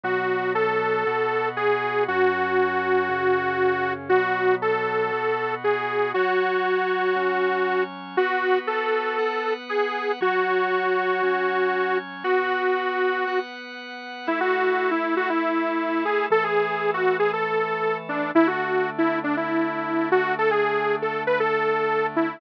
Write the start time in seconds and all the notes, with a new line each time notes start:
0.03 B2 F#3 B3 F#4
0.55 A4
1.07 B2 B3 F#4
1.57 G#4
2.08 F#2 F#3 C#4 F#4
3.09 F#2 C#3 C#4
4.09 B2 F#3 B3 F#4
4.62 A4
5.12 B2 B3 F#4
5.64 G#4
6.14 F#3 F#4 C#5
7.16 F#3 C#4 C#5
8.17 B3 F#4 B4
8.67 A4
9.19 B3 B4 F#5
9.69 G#4
10.21 F#3 F#4 C#5
11.23 F#3 C#4 C#5
12.24 B3 F#4 B4
13.27 B3 B4 F#5
14.27 A3 E4 A4
14.40 F#4
14.91 E4
15.17 F#4
15.30 E4
16.05 G#4
16.30 E3 A3 A4
16.44 G#4
16.94 F#4
17.19 G#4
17.33 A4
18.09 D4
18.35 D3 A3 D4 E4
18.47 F#4
18.98 E4
19.24 D4
19.37 E4
20.12 F#4
20.38 A4
20.51 G#4
21.02 A4
21.27 B4
21.40 A4
22.16 E4